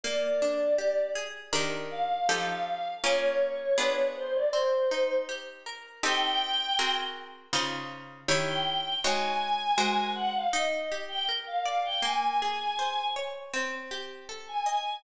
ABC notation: X:1
M:4/4
L:1/16
Q:1/4=80
K:Cphr
V:1 name="Choir Aahs"
=d6 z4 f3 f3 | d6 c =d c4 z4 | g6 z7 g3 | a6 _g f e2 z =g z f f g |
a6 z7 a3 |]
V:2 name="Acoustic Guitar (steel)"
B,2 =D2 G2 A2 [E,DGB]4 [F,EG=A]4 | [B,DFA]4 [=B,=DFA]4 C2 E2 G2 _B2 | [CEG=A]4 [C_G_AB]4 [D,EFc]4 [E,_F=Gd]4 | [A,E_Gd]4 [A,GBc]4 E2 =G2 B2 =d2 |
B,2 A2 c2 d2 C2 G2 =A2 e2 |]